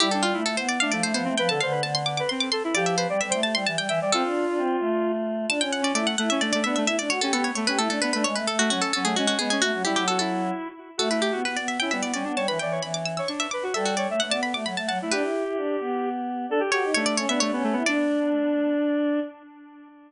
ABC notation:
X:1
M:3/4
L:1/16
Q:1/4=131
K:C
V:1 name="Harpsichord"
G A F2 A c d f d c c2 | g a f2 a c' d' d' c' d' c'2 | d e c2 e g a c' a g g2 | A8 z4 |
[K:D] a g f d d f f e d d e e | e d c A A c c B A A B B | c B A F F A A ^G F F G G | F2 G G A A3 z4 |
A B G2 B d e g e d d2 | a b g2 b d' e' e' c' e d'2 | e F d2 f a b d' b a a2 | B8 z4 |
z2 c2 c d c e c4 | d12 |]
V:2 name="Lead 1 (square)"
E D F E z3 D A,2 B, C | B A c B z3 B C2 A E | G2 B d z c z4 e d | F10 z2 |
[K:D] z3 C A,2 A, C A, A, B, A, | z3 C B,2 A, C A, A, B, A, | z3 A, C2 C A, C C B, C | F2 E2 F E5 z2 |
F E G F z3 E B,2 C D | c B d c z3 c D2 B F | A2 c e z d z4 f E | G10 z2 |
A G G2 A,3 B, A, B, A, B, | D12 |]
V:3 name="Choir Aahs"
G,3 A, A, B,2 A, F, A, F, A, | F, D, D,2 D,4 z4 | F,3 G, G, A,2 G, E, G, E, G, | C D2 D C2 A,6 |
[K:D] D C C2 E z E2 D2 D2 | E D F G G z2 G E D D D | ^G, A, A,2 F, z F,2 G,2 G,2 | A, F, G, F,5 z4 |
A,3 B, B, B,2 C G, B, G, B, | G, E, E,2 E,4 z4 | G,3 A, A, B,2 A, F, A, F, A, | D E2 E D2 B,6 |
D z F _E D2 C D D C2 =E | D12 |]